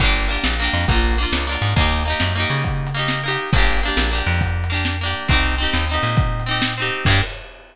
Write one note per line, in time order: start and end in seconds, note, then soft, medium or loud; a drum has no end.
0.00 0.38 G1 loud
0.00 0.28 A#3 loud
0.00 0.28 D4 loud
0.00 kick loud
0.00 closed hi-hat loud
0.05 0.28 G4 medium
0.28 0.55 A#3 medium
0.28 0.55 D4 medium
0.33 0.55 G4 medium
0.33 closed hi-hat medium
0.44 0.69 A#1 medium
0.44 snare loud
0.60 0.87 A#3 medium
0.60 0.87 D4 medium
0.64 0.87 G4 medium
0.64 closed hi-hat medium
0.73 0.86 F2 medium
0.88 1.26 A#1 loud
0.88 1.16 A#3 loud
0.88 1.16 D4 medium
0.88 kick loud
0.88 closed hi-hat loud
0.93 1.16 F4 medium
1.11 closed hi-hat medium
1.18 1.45 A#3 medium
1.18 1.45 D4 medium
1.23 1.45 F4 medium
1.32 1.57 C#2 medium
1.32 snare loud
1.47 1.74 A#3 medium
1.47 1.74 D4 medium
1.51 1.74 F4 medium
1.51 closed hi-hat medium
1.62 1.74 G#2 medium
1.76 2.14 D#2 loud
1.76 2.03 A#3 medium
1.76 2.03 D#4 medium
1.76 kick loud
1.76 closed hi-hat loud
1.81 2.03 G4 loud
1.99 closed hi-hat medium
2.06 2.33 A#3 medium
2.06 2.33 D#4 medium
2.10 2.33 G4 medium
2.20 2.46 F#2 medium
2.20 snare loud
2.35 2.89 A#3 medium
2.35 2.89 D#4 medium
2.40 2.89 G4 medium
2.40 closed hi-hat medium
2.50 3.37 C#3 medium
2.64 kick loud
2.64 closed hi-hat loud
2.87 closed hi-hat medium
2.94 3.22 A#3 medium
2.94 3.22 D#4 medium
2.99 3.22 G4 medium
3.08 snare loud
3.24 3.51 A#3 medium
3.24 3.51 D#4 medium
3.28 3.51 G4 medium
3.28 closed hi-hat medium
3.53 3.90 G1 loud
3.53 3.80 A#3 loud
3.53 3.80 D4 medium
3.53 kick loud
3.53 closed hi-hat loud
3.58 3.80 G4 loud
3.76 closed hi-hat medium
3.83 4.10 A#3 medium
3.83 4.10 D4 medium
3.88 4.10 G4 medium
3.97 4.22 A#1 medium
3.97 snare loud
4.11 4.65 A#3 medium
4.11 4.65 D4 medium
4.15 4.65 G4 medium
4.15 closed hi-hat medium
4.27 5.14 F2 medium
4.41 kick loud
4.41 closed hi-hat loud
4.64 closed hi-hat medium
4.70 4.97 A#3 medium
4.70 4.97 D4 medium
4.74 4.97 G4 medium
4.85 snare loud
5.01 5.28 A#3 medium
5.01 5.28 D4 medium
5.06 5.28 G4 medium
5.06 closed hi-hat medium
5.28 5.67 C2 medium
5.28 5.56 C4 medium
5.28 5.56 D#4 loud
5.28 kick loud
5.28 closed hi-hat loud
5.33 5.56 G4 loud
5.52 closed hi-hat medium
5.58 5.85 C4 medium
5.58 5.85 D#4 medium
5.63 5.85 G4 medium
5.73 5.99 D#2 medium
5.73 snare loud
5.89 6.43 C4 medium
5.89 6.43 D#4 medium
5.94 6.43 G4 medium
5.94 closed hi-hat medium
6.03 6.91 A#2 medium
6.17 kick loud
6.17 closed hi-hat loud
6.40 closed hi-hat medium
6.46 6.73 C4 medium
6.46 6.73 D#4 medium
6.51 6.73 G4 medium
6.62 snare loud
6.78 7.05 C4 medium
6.78 7.05 D#4 medium
6.82 7.05 G4 loud
6.82 closed hi-hat medium
7.05 7.21 G2 loud
7.05 7.21 A#3 loud
7.05 7.21 D4 loud
7.05 kick loud
7.05 crash loud
7.10 7.21 G4 loud